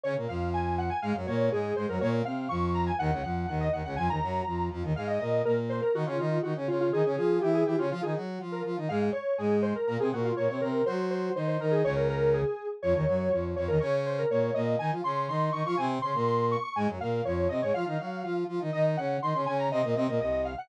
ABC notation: X:1
M:2/2
L:1/8
Q:1/2=122
K:Db
V:1 name="Lead 1 (square)"
d z f2 a2 g a | f z d2 A2 c B | d z f2 d'2 b a | g2 g2 g e g g |
a b5 z2 | f e e2 B z c B | G F F2 G z F F | A2 A2 =G A G F |
F A z3 B z2 | f z d2 A2 c B | B A G F d d B2 | c2 c2 c c B A |
d B B2 A3 z | d6 d B | d2 c B d2 e2 | a z c'2 c'2 d' d' |
a z c'2 c'2 d' d' | a z f2 d2 e d | f5 z3 | e z g2 c'2 a b |
e2 e2 e e f g |]
V:2 name="Brass Section"
[D,D] [B,,B,] [F,,F,]6 | [A,,A,] [G,,G,] [B,,B,]2 [A,,A,]2 [A,,A,] [G,,G,] | [B,,B,]2 [C,C]2 [F,,F,]4 | [E,,E,] [D,,D,] [F,,F,]2 [E,,E,]2 [E,,E,] [D,,D,] |
[F,,F,] [E,,E,] [G,,G,]2 [F,,F,]2 [F,,F,] [E,,E,] | [A,,A,]2 [B,,B,]2 [B,,B,]3 z | [E,E] [D,D] [E,E]2 [E,E] [D,D] [D,D]2 | [E,E] [D,D] [F,F]2 [=E,=E]2 [E,E] [D,D] |
[F,F] [E,E] [G,G]2 [F,F]2 [F,F] [E,E] | [A,,A,]2 z2 [A,,A,]3 z | [B,,B,] [C,C] [B,,B,]2 [B,,B,] [C,C] [C,C]2 | [G,G]4 [E,E]2 [E,E]2 |
[D,,D,]5 z3 | [F,,F,] [E,,E,] [G,,G,]2 [F,,F,]2 [F,,F,] [E,,E,] | [D,D]4 [B,,B,]2 [B,,B,]2 | [E,E] [F,F] [D,D]2 [E,E]2 [E,E] [F,F] |
[C,C]2 [D,D] [B,,B,]4 z | [A,,A,] [G,,G,] [B,,B,]2 [F,,F,]2 [C,C] [A,,A,] | [F,F] [E,E] [G,G]2 [F,F]2 [F,F] [E,E] | [E,E]2 [D,D]2 [E,E] [D,D] [D,D]2 |
[C,C] [B,,B,] [C,C] [B,,B,] [C,,C,]3 z |]